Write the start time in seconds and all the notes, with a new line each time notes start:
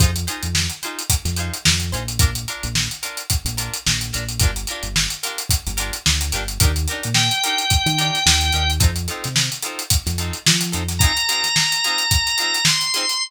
0.00 F2 D#4 F4 G#4 C5, kick, closed hi-hat
0.16 closed hi-hat
0.27 D#4 F4 G#4 C5, closed hi-hat
0.43 F2, closed hi-hat
0.55 snare
0.69 closed hi-hat
0.83 D#4 F4 G#4 C5, closed hi-hat
0.99 closed hi-hat
1.10 kick, closed hi-hat
1.25 F2, snare, closed hi-hat
1.36 D#4 F4 G#4 C5, closed hi-hat
1.54 closed hi-hat
1.65 F2, snare
1.80 closed hi-hat
1.92 A#1 D#4 F4 G#4 C5, closed hi-hat
2.08 closed hi-hat
2.19 D4 F4 A#4, kick, closed hi-hat
2.35 closed hi-hat
2.48 D4 F4 A#4, closed hi-hat
2.63 A#1, closed hi-hat
2.75 snare
2.91 closed hi-hat
3.03 D4 F4 A#4, closed hi-hat
3.17 closed hi-hat
3.30 kick, closed hi-hat
3.45 A#1, closed hi-hat
3.57 D4 F4 A#4, closed hi-hat
3.74 closed hi-hat
3.86 A#1, snare
4.01 closed hi-hat
4.13 A#1 D4 F4 A#4, snare, closed hi-hat
4.29 closed hi-hat
4.40 G1 D4 F4 G4 A#4, kick, closed hi-hat
4.56 closed hi-hat
4.67 F4 G4 A#4, closed hi-hat
4.71 D4
4.83 G1, closed hi-hat
4.96 snare
5.10 closed hi-hat
5.23 D4 F4 G4 A#4, closed hi-hat
5.38 closed hi-hat
5.49 kick, closed hi-hat
5.67 G1, closed hi-hat
5.77 D4 F4 G4 A#4, closed hi-hat
5.93 closed hi-hat
6.06 D2, snare
6.21 closed hi-hat
6.32 G1 D4 F4 G4 A#4, snare, closed hi-hat
6.48 closed hi-hat
6.60 D#2 D4 D#4 G4 A#4, kick, closed hi-hat
6.76 closed hi-hat
6.88 D#4 G4 A#4, closed hi-hat
6.92 D4
7.03 A#2, closed hi-hat
7.14 G5, snare
7.31 closed hi-hat
7.44 D4 D#4 G4 A#4, closed hi-hat
7.58 closed hi-hat
7.70 kick, closed hi-hat
7.86 D#3, closed hi-hat
7.98 D4 D#4 G4 A#4, snare, closed hi-hat
8.14 snare, closed hi-hat
8.26 D#2, snare
8.41 closed hi-hat
8.52 D#2 D#4 G4 A#4, closed hi-hat
8.56 D4
8.70 closed hi-hat
8.80 F2 C4 D#4 F4 A4, kick, closed hi-hat
8.96 closed hi-hat
9.08 C4 D#4 F4 A4, closed hi-hat
9.24 C3, snare, closed hi-hat
9.36 snare
9.52 closed hi-hat
9.63 C4 D#4 F4 A4, closed hi-hat
9.79 closed hi-hat
9.90 kick, closed hi-hat
10.06 F2, snare, closed hi-hat
10.18 C4 D#4 F4 A4, closed hi-hat
10.33 closed hi-hat
10.46 F3, snare
10.61 snare, closed hi-hat
10.72 F2 C4 D#4 F4 A4, closed hi-hat
10.89 snare, closed hi-hat
10.99 F4 G#4 A#5, kick, closed hi-hat
11.03 C4 D#4
11.17 closed hi-hat
11.29 C4 D#4 F4 G#4, closed hi-hat
11.44 snare, closed hi-hat
11.56 snare
11.72 closed hi-hat
11.84 C4 D#4 F4 G#4, closed hi-hat
11.98 closed hi-hat
12.11 kick, closed hi-hat
12.27 closed hi-hat
12.38 C4 D#4 F4 G#4, closed hi-hat
12.54 closed hi-hat
12.65 C6, snare
12.81 closed hi-hat
12.94 C4 D#4 F4 G#4, closed hi-hat
13.09 closed hi-hat